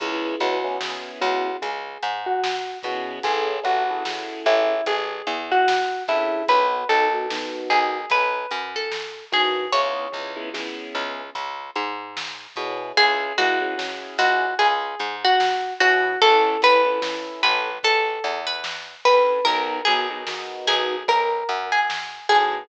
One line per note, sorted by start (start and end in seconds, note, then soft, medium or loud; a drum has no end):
0.00 0.36 C#2 medium
0.00 0.35 B3 loud
0.00 0.35 C#4 loud
0.00 0.35 E4 loud
0.00 0.35 G#4 medium
0.00 0.35 G#4 loud
0.00 kick loud
0.00 closed hi-hat loud
0.40 1.11 C#2 medium
0.40 0.60 B3 loud
0.40 0.60 C#4 loud
0.40 0.60 E4 loud
0.40 1.10 F#4 medium
0.40 0.60 G#4 loud
0.40 closed hi-hat medium
0.64 0.77 B3 loud
0.64 0.77 C#4 loud
0.64 0.77 E4 medium
0.64 0.77 G#4 loud
0.81 1.50 B3 medium
0.81 1.50 C#4 medium
0.81 1.50 E4 loud
0.81 1.50 G#4 loud
0.81 snare loud
1.21 1.57 C#2 medium
1.21 1.56 F#4 medium
1.21 closed hi-hat medium
1.62 1.98 C#2 medium
1.62 2.12 G#4 medium
1.62 kick medium
1.62 closed hi-hat loud
2.03 2.74 G#2 medium
2.03 closed hi-hat medium
2.26 2.78 F#4 medium
2.44 snare loud
2.83 3.19 B2 medium
2.83 3.19 B3 loud
2.83 3.19 C#4 loud
2.83 3.19 E4 medium
2.83 3.23 F#4 medium
2.83 3.19 G#4 loud
2.83 kick medium
2.83 snare medium
2.83 closed hi-hat medium
3.23 3.60 A1 medium
3.23 3.58 C#4 loud
3.23 3.58 E4 loud
3.23 3.63 G#4 medium
3.23 3.58 G#4 loud
3.23 3.58 A4 loud
3.23 kick loud
3.23 closed hi-hat loud
3.63 4.36 A1 medium
3.63 3.83 C#4 loud
3.63 3.83 E4 loud
3.63 4.41 F#4 medium
3.63 3.83 G#4 medium
3.63 3.83 A4 loud
3.63 kick medium
3.63 closed hi-hat medium
3.90 4.03 C#4 loud
3.90 4.03 E4 loud
3.90 4.03 G#4 loud
3.90 4.03 A4 loud
4.05 4.74 C#4 medium
4.05 4.74 E4 medium
4.05 4.74 G#4 loud
4.05 4.74 A4 medium
4.05 snare loud
4.46 4.81 A1 medium
4.46 4.84 E4 medium
4.46 closed hi-hat medium
4.86 5.22 A1 medium
4.86 5.39 G#4 medium
4.86 kick loud
4.86 closed hi-hat loud
5.27 5.98 E2 medium
5.27 closed hi-hat medium
5.52 6.03 F#4 medium
5.68 snare loud
6.08 6.44 G2 medium
6.08 6.42 C#4 medium
6.08 6.42 E4 medium
6.08 6.45 E4 medium
6.08 6.42 G#4 loud
6.08 6.42 A4 loud
6.08 kick medium
6.08 snare medium
6.08 closed hi-hat medium
6.48 6.84 B1 medium
6.48 6.83 B3 loud
6.48 6.83 D#4 loud
6.48 6.83 F#4 loud
6.48 6.83 A#4 loud
6.48 6.88 B4 medium
6.48 kick loud
6.48 closed hi-hat loud
6.89 7.60 B1 medium
6.89 7.08 B3 medium
6.89 7.08 D#4 loud
6.89 7.08 F#4 medium
6.89 7.61 A4 medium
6.89 7.08 A#4 loud
6.89 closed hi-hat medium
7.13 7.26 B3 medium
7.13 7.26 D#4 loud
7.13 7.26 F#4 loud
7.13 7.26 A#4 loud
7.30 7.98 B3 loud
7.30 7.98 D#4 medium
7.30 7.98 F#4 medium
7.30 7.98 A#4 medium
7.30 snare loud
7.70 8.06 B1 medium
7.70 8.09 G#4 medium
7.70 closed hi-hat medium
8.10 8.46 B1 medium
8.10 8.70 B4 medium
8.10 kick medium
8.10 closed hi-hat loud
8.51 9.22 F#2 medium
8.51 closed hi-hat medium
8.76 9.25 A4 medium
8.92 snare loud
9.32 9.68 A2 medium
9.32 9.66 B3 medium
9.32 9.66 D#4 loud
9.32 9.66 F#4 loud
9.32 9.71 G#4 medium
9.32 9.66 A#4 medium
9.32 kick medium
9.32 snare medium
9.32 closed hi-hat medium
9.72 10.08 C#2 medium
9.72 10.06 B3 loud
9.72 10.06 C#4 loud
9.72 10.06 E4 loud
9.72 10.06 G#4 loud
9.72 10.73 C#5 medium
9.72 kick loud
9.72 closed hi-hat loud
10.12 10.84 C#2 medium
10.12 10.31 B3 medium
10.12 10.31 C#4 medium
10.12 10.31 E4 medium
10.12 10.31 G#4 loud
10.12 kick medium
10.36 10.49 B3 loud
10.36 10.49 C#4 loud
10.36 10.49 E4 loud
10.36 10.49 G#4 loud
10.54 11.22 B3 loud
10.54 11.22 C#4 loud
10.54 11.22 E4 loud
10.54 11.22 G#4 loud
10.54 snare loud
10.95 11.30 C#2 medium
10.95 closed hi-hat medium
11.35 11.71 C#2 medium
11.35 kick medium
11.35 closed hi-hat loud
11.76 12.47 G#2 medium
11.76 closed hi-hat medium
12.17 snare loud
12.56 12.92 B2 medium
12.56 12.91 B3 loud
12.56 12.91 C#4 medium
12.56 12.91 E4 medium
12.56 12.91 G#4 loud
12.56 kick medium
12.56 snare medium
12.56 closed hi-hat medium
12.97 13.33 C#2 medium
12.97 13.33 C#4 loud
12.97 13.33 E4 loud
12.97 13.36 G#4 medium
12.97 13.33 G#4 loud
12.97 kick loud
12.97 closed hi-hat loud
13.38 14.09 C#2 medium
13.38 13.59 C#4 medium
13.38 13.59 E4 loud
13.38 14.15 F#4 medium
13.38 13.59 G#4 loud
13.38 closed hi-hat medium
13.61 13.74 C#4 medium
13.61 13.74 E4 medium
13.61 13.74 G#4 medium
13.78 14.45 C#4 loud
13.78 14.45 E4 medium
13.78 14.45 G#4 loud
13.78 snare loud
14.18 14.54 C#2 medium
14.18 14.55 F#4 medium
14.18 closed hi-hat medium
14.59 14.95 C#2 medium
14.59 15.15 G#4 medium
14.59 kick loud
14.59 closed hi-hat loud
14.99 15.71 G#2 medium
14.99 closed hi-hat medium
15.24 15.74 F#4 medium
15.40 snare loud
15.80 16.17 B2 medium
15.80 16.14 C#4 medium
15.80 16.14 E4 medium
15.80 16.19 F#4 medium
15.80 16.14 G#4 loud
15.80 kick medium
15.80 snare medium
15.80 closed hi-hat medium
16.22 16.57 A1 medium
16.22 16.57 C#4 loud
16.22 16.57 E4 loud
16.22 16.61 A4 medium
16.22 16.57 A4 loud
16.22 kick loud
16.22 closed hi-hat loud
16.62 17.33 A1 medium
16.62 16.82 C#4 loud
16.62 16.82 E4 loud
16.62 16.82 A4 loud
16.62 17.41 B4 medium
16.62 kick medium
16.62 closed hi-hat medium
16.86 16.99 C#4 medium
16.86 16.99 E4 medium
16.86 16.99 A4 loud
17.02 17.69 C#4 medium
17.02 17.69 E4 medium
17.02 17.69 A4 medium
17.02 snare loud
17.43 17.79 A1 medium
17.43 17.77 B4 medium
17.43 closed hi-hat medium
17.83 18.19 A1 medium
17.83 18.40 A4 medium
17.83 kick medium
17.83 closed hi-hat loud
18.24 18.95 E2 medium
18.24 closed hi-hat medium
18.47 18.95 B4 medium
18.64 snare loud
19.05 19.41 G2 medium
19.05 19.40 C#4 loud
19.05 19.40 E4 medium
19.05 19.40 A4 loud
19.05 19.45 B4 medium
19.05 kick medium
19.05 snare medium
19.05 closed hi-hat medium
19.45 19.82 B1 medium
19.45 19.79 B3 loud
19.45 19.79 D#4 loud
19.45 19.79 F#4 loud
19.45 19.83 A#4 medium
19.45 19.79 A#4 loud
19.45 kick loud
19.45 closed hi-hat loud
19.85 20.58 B1 medium
19.85 20.07 B3 loud
19.85 20.07 D#4 medium
19.85 20.07 F#4 medium
19.85 20.58 G#4 medium
19.85 20.07 A#4 loud
19.85 closed hi-hat medium
20.10 20.23 B3 loud
20.10 20.23 D#4 loud
20.10 20.23 F#4 loud
20.10 20.23 A#4 loud
20.27 20.95 B3 medium
20.27 20.95 D#4 loud
20.27 20.95 F#4 medium
20.27 20.95 A#4 medium
20.27 snare loud
20.67 21.03 B1 medium
20.67 21.06 G#4 medium
20.67 closed hi-hat medium
21.08 21.44 B1 medium
21.08 21.66 A#4 medium
21.08 kick medium
21.08 closed hi-hat medium
21.49 22.20 F#2 medium
21.49 closed hi-hat medium
21.72 22.27 G#4 medium
21.90 snare loud
22.29 22.65 A2 medium
22.29 22.63 B3 medium
22.29 22.63 D#4 medium
22.29 22.63 F#4 loud
22.29 22.64 G#4 medium
22.29 22.63 A#4 loud
22.29 kick medium
22.29 snare medium
22.29 closed hi-hat medium